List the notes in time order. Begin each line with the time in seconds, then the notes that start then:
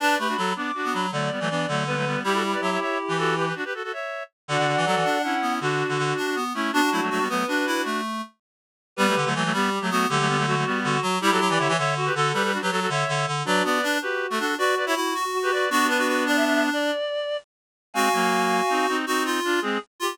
0.00 D4 B4 D5 A5
0.19 A3 G4 B4 B5
0.28 D4 F#4
0.37 F#3 F#4 A4
0.56 B3 D4 D6
0.75 D4 F#4
0.85 B3
0.93 F#3 B5
1.12 D3 F#3 A3 D5
1.31 G3 B3
1.40 E3 F#3 A3
1.50 E3 B3 D4
1.68 D3 F#3 A3
1.86 G3 B3 B4
1.96 F#3 A3
2.06 G3 B3
2.24 G3 E4 G4
2.34 F#4 A4
2.52 B4 D5
2.61 F#3 C#5 E5
2.71 C#5 E5
2.81 C#5 E5
3.08 E3 G4 B4
3.18 F#4 A4
3.37 G4 B4
3.46 G4 B4
3.55 D4 F#4
3.65 G4 B4
3.74 F#4 A4
3.83 F#4 A4
3.92 C#5 E5
4.48 D3 D4 F#4 D5 F#5
4.58 D3
4.67 D3
4.77 E3
4.86 F#3 F#4 A4
4.95 E3
5.05 D4
5.23 C#4 E4 F#5
5.42 B3
5.61 D3 D4 F#4
5.89 D3
5.98 D3
6.17 D4
6.36 B3
6.54 A3 C#4 E4
6.72 B3 D4 F#4
6.92 F#3 A3 E4
7.01 F#3 A3
7.10 F#3 A3 F#4
7.19 G3 B3
7.29 F#3 A3 B3 B4
7.48 D4 F#4
7.67 E4
7.85 A3
8.96 G3 B3 G4 B4
9.07 F#3 A3
9.16 D3
9.25 D3 F#3 A3
9.35 E3 F#3 A3
9.44 F#3 A3
9.53 G3 B3 G4
9.81 F#3 A3
9.91 F#3 A3 B3 F#4
10.09 D3 F#3 A3 G4
10.19 F#3 A3
10.28 G3 B3
10.37 F#3 A3
10.46 F#3 A3 F#4
10.56 F#3 A3
10.66 G3 B3
10.84 D3 F#4
11.02 F#3
11.21 G3 E4 G4
11.31 F#3 F#4 A4
11.40 F#3
11.49 E3 B4 D5
11.59 D3 C#5 E5
11.68 E3 C#5 E5
11.77 D3 C#5 E5
11.96 F#4
12.06 G4 B4
12.14 D3 F#4 A4
12.33 G3 G4 B4
12.44 G4 B4
12.52 D4 F#4
12.62 F#3 G4 B4
12.71 F#3 F#4 A4
12.81 F#4 A4
12.89 D3 C#5 E5
13.08 D3
13.27 D3
13.45 F#3 D4 F#4 B4 D5
13.64 B3 B4 D5
13.83 D4
14.02 F#4 G4 B4
14.30 A3 F#4 A4
14.39 D4 F#4 A4
14.58 F#4 B4 D5
14.76 B4 D5
14.86 E4 C#5 E5
14.95 E4 F#4
15.14 F#4
15.33 F#4
15.43 G4 B4
15.52 B4 D5
15.70 B3 D4 F#4
15.88 D4 B4
15.99 F#4
16.08 F#4
16.26 D4 D5
16.36 E5
16.45 E5
16.54 E5
16.73 D5
17.94 G#3 C4 F#4 F5 G#5
18.13 F#3 A#3
18.69 C4 D#4
18.88 C4 D#4
19.07 C4 D#4 F#4
19.25 F4
19.44 D4 F4
19.61 G#3 C4 G#4
20.00 F4 G4